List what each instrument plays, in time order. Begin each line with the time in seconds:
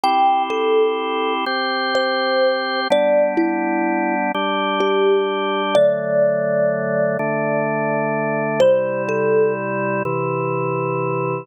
0.04 drawbar organ C4 E4 G4, kalimba G5
0.50 kalimba A4
1.46 drawbar organ C4 G4 C5
1.95 kalimba C5
2.90 drawbar organ G3 B3 D4, kalimba D5
3.37 kalimba E4
4.35 drawbar organ G3 D4 G4
4.80 kalimba G4
5.75 drawbar organ D3 F#3 A3, kalimba D5
7.19 drawbar organ D3 A3 D4
8.60 drawbar organ C3 G3 E4, kalimba C5
9.09 kalimba A4
10.05 drawbar organ C3 E3 E4